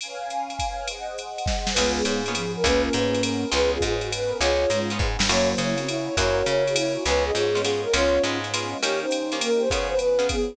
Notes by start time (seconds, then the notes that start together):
0.01 C#4 B4 F5 G#5, ride
0.30 hi-hat pedal, ride
0.50 ride
0.59 kick, ride
0.88 G#4 C5 D#5 F#5, ride
1.18 hi-hat pedal, ride
1.38 ride
1.46 kick, snare
1.67 snare
1.74 C#2 G#3 B3 C#4 F4 G#4 B4, crash, ride
1.78 B3 C#4 F4 G#4
1.95 G#4
2.04 G#2 G#4, hi-hat pedal, ride
2.25 A#3 B3 C#4 F4 G#4 B4, ride
2.35 F3 G#4, ride
2.56 A#4
2.63 C#2 A#3 B3 C#4 F4 G#4 B4, kick, ride
2.85 A#4
2.93 G#2 B4, hi-hat pedal, ride
3.14 B3 C#4 G#4 B4, ride
3.22 A#4, ride
3.52 C#2 B3 C#4 F4 G#4 B4, ride
3.72 F4 G#4
3.81 G#2, kick, hi-hat pedal, ride
3.85 G#4
4.01 B3 C#4 F#4 G#4 B4, ride
4.11 B4, ride
4.29 A#4
4.40 C#2 B3 C#4 F4 G#4 C#5, ride
4.70 G#2 G#3, hi-hat pedal, ride
4.90 B3 C#4 F4 G#4 B4, ride
4.99 G#2, kick
5.19 G2, snare
5.29 F#2 F#3 A#3 C#4 E4 F#4 C#5, crash, ride
5.52 C5
5.58 C#3 C#5, hi-hat pedal, ride
5.78 C4, ride
5.87 E4 C#5, ride
6.08 C#5
6.17 F#2 A#3 C#4 E4 F#4 A#4 C#5, kick, ride
6.37 C#5
6.46 C#3 C#5, hi-hat pedal, ride
6.67 G#4, ride
6.76 E4 C#5, ride
7.05 C#2 G#3 B3 C#4 F4 B4 C#5, ride
7.24 G#4 D#5
7.34 G#2 G#4 C#5, hi-hat pedal, ride
7.55 G#3 B3 C#4 F4, ride
7.62 G#3 B3 C#4 F4 G#4, ride
7.83 A#4
7.93 C#2 G#3 B3 C#4 F4 C#5, ride
8.23 G#2 G#3 B3 C#4 F4, hi-hat pedal, ride
8.44 ride
8.54 G#3 B3 C#4 F4, ride
8.82 D#3 A#3 C#4 G4 C#5, ride
9.01 D#4 C5
9.11 hi-hat pedal, ride
9.32 D#3 A#3 C#4 G4, ride
9.41 A#3 A#4, ride
9.60 C5
9.70 C#3 F3 B3 F4 G#4 B4 C#5, kick, ride
9.89 B4 C5
9.99 B4, hi-hat pedal, ride
10.19 C#3 B3 F4 G#4, ride
10.29 B3 G#4, kick, ride